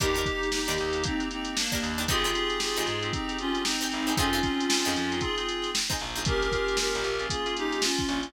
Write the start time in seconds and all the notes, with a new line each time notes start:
0.00 D#2 A#3 D4 D#4 G4 A#4, kick, closed hi-hat
0.14 D4 D#4 G4 A#4, closed hi-hat
0.26 A#3 D4 D#4 G4, kick, closed hi-hat
0.43 closed hi-hat
0.52 D#4 G4, snare
0.66 D#2 D4 D#4 G4, closed hi-hat
0.71 A#4
0.78 D#2, snare, closed hi-hat
0.93 A#3 D4 D#4 G4, closed hi-hat
1.04 A#3 C4 D4 D#4 G4, kick, closed hi-hat
1.20 A#3 D4 D#4 G4, closed hi-hat
1.31 C4 D#4, closed hi-hat
1.45 closed hi-hat
1.56 A#3 D4, snare
1.72 D4 D#4 G4 A#4, kick, closed hi-hat
1.83 D#2, closed hi-hat
1.97 D4 D#4 G4 A#4, snare, closed hi-hat
2.08 G#1 C4 D#4 F4 G4 G#4, kick, closed hi-hat
2.24 C4 D#4 G4 G#4, closed hi-hat
2.35 C4 D#4 G4 G#4, snare, closed hi-hat
2.50 closed hi-hat
2.60 F4 G#4, snare
2.76 G#1 C4 D#4 G4 G#4, closed hi-hat
2.87 G#2, closed hi-hat
3.02 C4 D#4 G4 G#4, closed hi-hat
3.13 C4 D#4 G4 G#4, kick, closed hi-hat
3.28 C4 D#4 G4 G#4, closed hi-hat
3.38 C#4 F4, closed hi-hat
3.55 closed hi-hat
3.65 C4 D#4, snare
3.81 C4 D#4 G4 G#4, closed hi-hat
3.92 G#1, closed hi-hat
4.07 C4 D#4 G4 G#4, closed hi-hat
4.17 F2 C4 C#4 D#4 F4 G#4, kick, closed hi-hat
4.33 C4 D#4 F4 G#4, closed hi-hat
4.43 C4 D#4 F4 G#4, kick, snare, closed hi-hat
4.60 closed hi-hat
4.70 snare
4.85 F2 C4 D#4 F4 G#4, closed hi-hat
4.96 F2, closed hi-hat
5.11 C4 D#4 F4 G#4, closed hi-hat
5.21 C4 D#4 F4 G#4, kick, closed hi-hat
5.37 C4 D#4 F4 G#4, closed hi-hat
5.49 closed hi-hat
5.62 snare, closed hi-hat
5.75 snare
5.90 C4 D#4 F4 G#4, kick, closed hi-hat
6.00 A#1, snare, closed hi-hat
6.15 C4 D#4 F4 G#4, closed hi-hat
6.25 A#3 C#4 F4 G4 G#4 A#4, kick, closed hi-hat
6.42 closed hi-hat
6.52 A#3 C#4 F4 G#4, kick, closed hi-hat
6.68 closed hi-hat
6.77 G4 A#4, snare
6.95 A#1, closed hi-hat
7.04 A#1, closed hi-hat
7.19 A#3 C#4 F4 G#4, closed hi-hat
7.30 A#3 C#4 F4 G#4, kick, closed hi-hat
7.46 A#3 C#4 F4 G#4, closed hi-hat
7.57 D#4 G4, closed hi-hat
7.72 closed hi-hat
7.82 C#4 F4, snare
7.98 kick, snare, closed hi-hat
8.08 A#1, snare, closed hi-hat
8.23 closed hi-hat